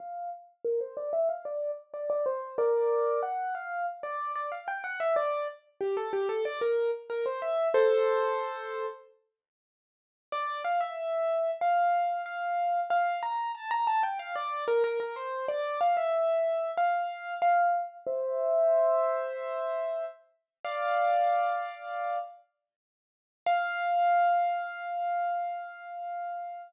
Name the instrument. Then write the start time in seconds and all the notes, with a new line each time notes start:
acoustic grand piano
0.00 F5
0.65 A#4
0.81 C5
0.97 D5
1.13 E5
1.29 F5
1.45 D5
1.94 D5
2.10 D5
2.26 C5
2.58 A#4 D5
3.23 F#5
3.55 F5
4.03 D5
4.35 D5
4.52 F5
4.68 G5
4.84 F#5
5.00 E5
5.16 D5
5.81 G4
5.97 A4
6.13 G4
6.29 A4
6.45 D5
6.61 A#4
7.10 A#4
7.26 C5
7.42 E5
7.74 A4 C5
10.32 D5
10.65 F5
10.81 E5
11.61 F5
12.26 F5
12.90 F5
13.23 A#5
13.55 A5
13.71 A#5
13.87 A5
14.03 G5
14.19 F5
14.35 D5
14.68 A#4
14.84 A#4
15.00 A#4
15.16 C5
15.48 D5
15.81 F5
15.97 E5
16.77 F5
17.42 F5
18.07 C5 E5
20.65 D5 F5
23.46 F5